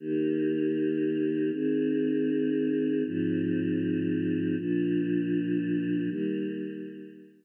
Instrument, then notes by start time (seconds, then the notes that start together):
choir aahs
0.00 D#3 A#3 G4
1.52 D#3 C4 G#4
3.05 G#2 F3 C4
4.58 A#2 F3 D4
6.09 D#3 G3 A#3